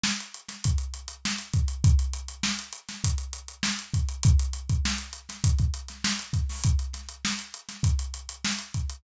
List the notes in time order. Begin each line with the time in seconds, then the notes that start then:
0.04 snare
0.20 closed hi-hat
0.34 closed hi-hat
0.48 snare, closed hi-hat
0.64 kick, closed hi-hat
0.78 closed hi-hat
0.94 closed hi-hat
1.08 closed hi-hat
1.25 snare
1.38 closed hi-hat
1.53 kick, closed hi-hat
1.68 closed hi-hat
1.84 kick, closed hi-hat
1.99 closed hi-hat
2.13 closed hi-hat
2.28 closed hi-hat
2.43 snare
2.59 closed hi-hat
2.73 closed hi-hat
2.89 snare, closed hi-hat
3.04 kick, closed hi-hat
3.18 closed hi-hat
3.33 closed hi-hat
3.48 closed hi-hat
3.63 snare
3.79 closed hi-hat
3.94 kick, closed hi-hat
4.08 closed hi-hat
4.23 kick, closed hi-hat
4.39 closed hi-hat
4.53 closed hi-hat
4.69 kick, closed hi-hat
4.85 snare
4.98 closed hi-hat
5.13 closed hi-hat
5.29 snare, closed hi-hat
5.44 kick, closed hi-hat
5.58 kick, closed hi-hat
5.74 closed hi-hat
5.88 snare, closed hi-hat
6.04 snare
6.19 snare, closed hi-hat
6.33 kick, closed hi-hat
6.49 snare, open hi-hat
6.63 kick, closed hi-hat
6.79 closed hi-hat
6.93 snare, closed hi-hat
7.08 closed hi-hat
7.25 snare
7.39 closed hi-hat
7.54 closed hi-hat
7.69 snare, closed hi-hat
7.83 kick, closed hi-hat
7.99 closed hi-hat
8.14 closed hi-hat
8.29 closed hi-hat
8.45 snare
8.59 closed hi-hat
8.74 kick, closed hi-hat
8.89 closed hi-hat